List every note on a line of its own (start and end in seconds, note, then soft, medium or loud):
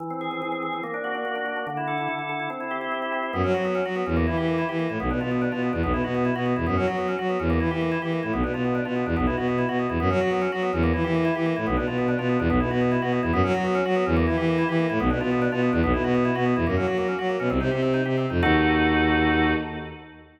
0.00 0.41 E3 medium
0.10 0.31 C4 medium
0.21 0.62 G#4 medium
0.31 0.52 C4 medium
0.42 0.81 E3 medium
0.52 0.72 C4 medium
0.63 0.82 G#4 medium
0.73 0.83 C4 medium
0.83 1.24 A#3 medium
0.94 1.14 D4 medium
1.04 1.45 F#4 medium
1.15 1.35 D4 medium
1.25 1.65 A#3 medium
1.35 1.56 D4 medium
1.46 1.66 F#4 medium
1.56 1.66 D4 medium
1.67 2.08 D3 medium
1.77 1.97 E4 medium
1.87 2.29 A4 medium
1.98 2.18 E4 medium
2.08 2.48 D3 medium
2.19 2.39 E4 soft
2.29 2.49 A4 medium
2.40 2.49 E4 soft
2.50 2.91 C4 medium
2.60 2.81 E4 medium
2.71 3.12 G4 medium
2.81 3.02 E4 medium
2.92 3.31 C4 medium
3.02 3.22 E4 medium
3.12 3.32 G4 medium
3.23 3.33 E4 medium
3.33 3.42 F#2 medium
3.33 3.43 B3 medium
3.44 3.53 F#3 medium
3.44 3.53 C#4 medium
3.54 3.81 F#3 medium
3.54 3.64 F#4 medium
3.65 3.74 B3 medium
3.75 3.84 C#4 medium
3.85 4.03 F#3 medium
3.85 3.95 F#4 medium
3.96 4.05 B3 medium
4.06 4.26 E2 medium
4.06 4.16 C#4 medium
4.17 4.26 A#3 medium
4.27 4.37 E3 medium
4.27 4.36 E4 medium
4.37 4.64 E3 medium
4.37 4.47 G4 medium
4.48 4.57 A#3 medium
4.58 4.68 E4 medium
4.69 4.87 E3 medium
4.69 4.78 G4 medium
4.79 4.89 A#3 medium
4.89 4.98 A2 medium
4.89 4.99 E4 medium
5.00 5.09 B1 medium
5.00 5.09 B3 medium
5.11 5.20 B2 medium
5.11 5.20 D4 medium
5.21 5.48 B2 medium
5.21 5.30 F4 medium
5.31 5.41 B3 medium
5.42 5.51 D4 medium
5.52 5.70 B2 medium
5.52 5.62 F4 medium
5.62 5.72 B3 soft
5.73 5.82 E2 medium
5.73 5.82 D4 medium
5.83 5.92 B1 medium
5.83 5.93 B3 medium
5.93 6.02 B2 medium
5.93 6.03 E4 medium
6.04 6.31 B2 medium
6.04 6.14 F#4 medium
6.15 6.24 B3 medium
6.25 6.34 E4 medium
6.36 6.53 B2 medium
6.36 6.45 F#4 medium
6.46 6.55 B3 medium
6.56 6.66 E2 medium
6.56 6.66 E4 medium
6.67 6.76 F#2 medium
6.67 6.76 B3 medium
6.77 6.86 F#3 medium
6.77 6.86 C#4 medium
6.87 7.15 F#3 medium
6.87 6.97 F#4 medium
6.98 7.07 B3 medium
7.08 7.18 C#4 medium
7.19 7.37 F#3 medium
7.19 7.28 F#4 medium
7.29 7.39 B3 medium
7.40 7.59 E2 medium
7.40 7.49 C#4 medium
7.50 7.59 A#3 medium
7.60 7.69 E3 medium
7.60 7.70 E4 medium
7.71 7.97 E3 medium
7.71 7.80 G4 medium
7.81 7.91 A#3 medium
7.92 8.01 E4 medium
8.02 8.20 E3 medium
8.02 8.11 G4 medium
8.12 8.22 A#3 medium
8.23 8.32 A2 medium
8.23 8.32 E4 medium
8.33 8.42 B1 medium
8.33 8.43 B3 medium
8.43 8.52 B2 medium
8.43 8.53 D4 medium
8.54 8.80 B2 medium
8.54 8.63 F4 medium
8.65 8.74 B3 medium
8.75 8.84 D4 medium
8.85 9.04 B2 medium
8.85 8.95 F4 medium
8.96 9.05 B3 soft
9.06 9.15 E2 medium
9.06 9.16 D4 medium
9.17 9.26 B1 medium
9.17 9.26 B3 medium
9.27 9.35 B2 medium
9.27 9.36 E4 medium
9.37 9.64 B2 medium
9.37 9.47 F#4 medium
9.48 9.57 B3 medium
9.58 9.68 E4 medium
9.69 9.86 B2 medium
9.69 9.78 F#4 medium
9.79 9.89 B3 medium
9.89 9.98 E2 medium
9.89 9.99 E4 medium
10.00 10.09 F#2 medium
10.00 10.09 B3 medium
10.10 10.19 F#3 medium
10.10 10.20 C#4 medium
10.21 10.47 F#3 medium
10.21 10.30 F#4 medium
10.31 10.41 B3 medium
10.42 10.51 C#4 medium
10.52 10.70 F#3 medium
10.52 10.62 F#4 medium
10.62 10.72 B3 medium
10.73 10.92 E2 medium
10.73 10.82 C#4 medium
10.83 10.93 A#3 medium
10.94 11.03 E3 medium
10.94 11.03 E4 medium
11.04 11.31 E3 medium
11.04 11.14 G4 medium
11.15 11.24 A#3 medium
11.25 11.34 E4 medium
11.35 11.53 E3 medium
11.35 11.45 G4 medium
11.46 11.55 A#3 medium
11.56 11.66 A2 medium
11.56 11.66 E4 medium
11.67 11.76 B1 medium
11.67 11.76 B3 medium
11.77 11.86 B2 medium
11.77 11.86 D4 medium
11.87 12.14 B2 medium
11.87 11.97 F4 medium
11.98 12.07 B3 medium
12.08 12.18 D4 medium
12.19 12.37 B2 medium
12.19 12.28 F4 medium
12.29 12.39 B3 medium
12.39 12.48 E2 medium
12.39 12.49 D4 medium
12.50 12.59 B1 medium
12.50 12.59 B3 medium
12.60 12.69 B2 medium
12.60 12.70 E4 medium
12.70 12.97 B2 medium
12.70 12.80 F#4 medium
12.81 12.91 B3 medium
12.92 13.01 E4 medium
13.02 13.20 B2 medium
13.02 13.11 F#4 medium
13.12 13.22 B3 medium
13.22 13.31 E2 medium
13.22 13.32 E4 medium
13.33 13.42 F#2 loud
13.33 13.43 B3 loud
13.44 13.53 F#3 loud
13.44 13.53 C#4 medium
13.54 13.81 F#3 medium
13.54 13.64 F#4 medium
13.65 13.74 B3 medium
13.75 13.84 C#4 medium
13.85 14.04 F#3 medium
13.85 13.95 F#4 medium
13.96 14.05 B3 medium
14.06 14.26 E2 loud
14.06 14.16 C#4 medium
14.17 14.26 A#3 loud
14.27 14.36 E3 medium
14.27 14.36 E4 medium
14.37 14.64 E3 medium
14.37 14.47 G4 medium
14.48 14.57 A#3 medium
14.58 14.68 E4 medium
14.69 14.86 E3 medium
14.69 14.78 G4 medium
14.79 14.88 A#3 medium
14.90 14.99 A2 medium
14.90 14.99 E4 medium
15.00 15.09 B1 medium
15.00 15.09 B3 medium
15.10 15.19 B2 medium
15.10 15.20 D4 medium
15.21 15.48 B2 medium
15.21 15.30 F4 medium
15.31 15.41 B3 medium
15.42 15.51 D4 medium
15.52 15.70 B2 medium
15.52 15.61 F4 medium
15.62 15.72 B3 medium
15.73 15.82 E2 medium
15.73 15.82 D4 medium
15.83 15.93 B1 loud
15.83 15.93 B3 loud
15.94 16.03 B2 medium
15.94 16.03 E4 medium
16.04 16.31 B2 medium
16.04 16.14 F#4 medium
16.15 16.24 B3 medium
16.25 16.34 E4 medium
16.35 16.54 B2 medium
16.35 16.45 F#4 medium
16.46 16.55 B3 medium
16.56 16.65 E2 medium
16.56 16.66 E4 medium
16.67 16.76 F#2 medium
16.67 16.76 A#3 medium
16.77 16.86 F#3 medium
16.77 16.86 C#4 medium
16.87 17.14 F#3 medium
16.87 16.97 F#4 medium
16.98 17.07 A#3 medium
17.08 17.18 C#4 medium
17.19 17.36 F#3 medium
17.19 17.28 F#4 medium
17.29 17.39 A#3 medium
17.40 17.48 B2 medium
17.40 17.49 C#4 medium
17.50 17.59 C2 medium
17.50 17.59 C4 medium
17.60 17.69 C3 medium
17.60 17.70 D#4 medium
17.71 18.01 C3 medium
17.71 17.81 G4 medium
17.83 17.93 C4 medium
17.94 18.04 D#4 medium
18.05 18.26 C3 medium
18.05 18.16 G4 medium
18.18 18.29 C4 medium
18.30 18.41 F2 medium
18.30 18.41 D#4 medium
18.43 19.53 D#2 loud
18.43 19.53 D#4 loud
18.43 19.53 F#4 loud
18.43 19.53 A4 loud